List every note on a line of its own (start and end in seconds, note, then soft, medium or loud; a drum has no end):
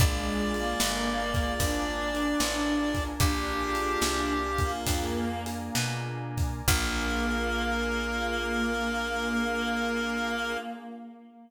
0.00 0.75 A#1 medium
0.00 0.53 G#3 loud
0.00 1.21 A#3 loud
0.00 1.21 D4 loud
0.00 1.21 F4 medium
0.00 1.21 G#4 medium
0.00 1.59 A#4 medium
0.00 1.59 D5 medium
0.00 3.04 D5 medium
0.00 1.59 F5 medium
0.00 1.59 G#5 medium
0.00 kick loud
0.00 closed hi-hat loud
0.54 1.53 A#3 medium
0.54 closed hi-hat medium
0.80 1.55 G1 medium
0.80 snare loud
1.34 1.58 A#3 medium
1.34 1.58 D4 medium
1.34 1.58 F4 medium
1.34 1.58 G#4 medium
1.34 kick medium
1.34 closed hi-hat medium
1.60 2.35 G#1 medium
1.60 2.10 A#3 medium
1.60 2.10 D4 medium
1.60 3.03 D4 medium
1.60 2.10 F4 medium
1.60 2.10 G#4 medium
1.60 3.19 A#4 medium
1.60 3.19 D5 medium
1.60 3.19 G#5 medium
1.60 3.19 A#5 medium
1.60 kick medium
1.60 closed hi-hat loud
2.14 3.14 A#3 medium
2.14 3.14 D4 medium
2.14 3.14 F4 medium
2.14 3.14 G#4 medium
2.14 closed hi-hat medium
2.40 3.15 A1 medium
2.40 snare loud
2.95 kick medium
2.95 closed hi-hat medium
3.20 3.96 A#1 medium
3.20 4.45 A#3 loud
3.20 4.34 D4 loud
3.20 4.45 D4 loud
3.20 4.45 F4 loud
3.20 4.72 G4 medium
3.20 4.45 G#4 medium
3.20 4.85 A#4 medium
3.20 4.85 D5 medium
3.20 4.85 F5 medium
3.20 4.85 G#5 medium
3.20 kick loud
3.20 closed hi-hat loud
3.75 closed hi-hat medium
4.02 4.81 C2 medium
4.02 snare loud
4.58 4.84 A#3 medium
4.58 5.41 A#3 medium
4.58 4.84 D4 medium
4.58 4.84 F4 medium
4.58 4.84 G#4 medium
4.58 kick medium
4.58 closed hi-hat medium
4.87 5.70 F2 medium
4.87 5.42 A#3 medium
4.87 5.42 D4 medium
4.87 5.42 F4 medium
4.87 5.42 G#4 medium
4.87 6.67 A#4 medium
4.87 6.67 D5 medium
4.87 6.67 G#5 medium
4.87 6.67 A#5 medium
4.87 kick medium
4.87 closed hi-hat loud
5.46 6.60 A#3 medium
5.46 6.60 D4 medium
5.46 6.60 F4 medium
5.46 6.60 G#4 medium
5.46 closed hi-hat medium
5.75 6.62 B2 medium
5.75 snare loud
6.37 kick medium
6.37 closed hi-hat medium
6.68 10.57 A#1 loud
6.68 10.57 A#3 loud
6.68 10.58 A#3 loud
6.68 10.57 D4 loud
6.68 10.57 F4 loud
6.68 10.57 G#4 loud
6.68 10.57 A#4 loud
6.68 kick loud
6.68 crash loud